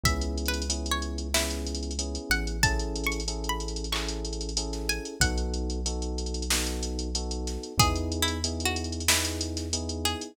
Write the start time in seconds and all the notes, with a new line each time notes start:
0.03 C#2 B3 C#4 E4 G#4 E5, kick, closed hi-hat
0.21 closed hi-hat
0.37 closed hi-hat
0.46 B4, closed hi-hat
0.54 closed hi-hat
0.62 closed hi-hat
0.69 B3 C#4 E4 G#4, closed hi-hat
0.86 closed hi-hat
0.91 C#5
1.02 closed hi-hat
1.18 closed hi-hat
1.34 B3 C#4 E4 G#4, snare
1.50 closed hi-hat
1.67 closed hi-hat
1.75 closed hi-hat
1.83 closed hi-hat
1.91 closed hi-hat
1.99 B3 C#4 E4 G#4, closed hi-hat
2.15 closed hi-hat
2.30 A1 F#5, closed hi-hat
2.47 closed hi-hat
2.63 C#4 E4 G#4 A4 A5, kick, closed hi-hat
2.79 closed hi-hat
2.96 closed hi-hat
3.04 C#6, closed hi-hat
3.12 closed hi-hat
3.20 closed hi-hat
3.28 C#4 E4 G#4 A4, closed hi-hat
3.44 closed hi-hat
3.49 B5
3.60 closed hi-hat
3.68 closed hi-hat
3.76 closed hi-hat
3.84 closed hi-hat
3.92 C#4 E4 G#4 A4 C#6, clap
4.08 closed hi-hat
4.25 closed hi-hat
4.33 closed hi-hat
4.41 closed hi-hat
4.49 closed hi-hat
4.57 C#4 E4 G#4 A4, closed hi-hat
4.73 snare, closed hi-hat
4.89 G#5, closed hi-hat
5.05 closed hi-hat
5.20 B1 B3 D#4 F#4 A4 F#5, kick, closed hi-hat
5.37 closed hi-hat
5.54 closed hi-hat
5.70 closed hi-hat
5.86 B3 D#4 F#4 A4, closed hi-hat
6.02 closed hi-hat
6.18 closed hi-hat
6.26 closed hi-hat
6.34 closed hi-hat
6.42 closed hi-hat
6.50 B3 D#4 F#4 A4, snare
6.67 closed hi-hat
6.83 closed hi-hat
6.99 closed hi-hat
7.15 B3 D#4 F#4 A4, closed hi-hat
7.31 closed hi-hat
7.47 snare, closed hi-hat
7.63 closed hi-hat
7.78 E2 B3 D#4 E4 G#4, kick, closed hi-hat
7.96 closed hi-hat
8.12 closed hi-hat
8.22 E4
8.28 closed hi-hat
8.44 B3 D#4 E4 G#4, closed hi-hat
8.60 closed hi-hat
8.65 F#4
8.76 closed hi-hat
8.84 closed hi-hat
8.92 closed hi-hat
9.00 closed hi-hat
9.08 B3 D#4 E4 G#4, snare
9.25 closed hi-hat
9.41 closed hi-hat
9.57 snare, closed hi-hat
9.73 B3 D#4 E4 G#4, closed hi-hat
9.89 closed hi-hat
10.05 G#4, closed hi-hat
10.21 closed hi-hat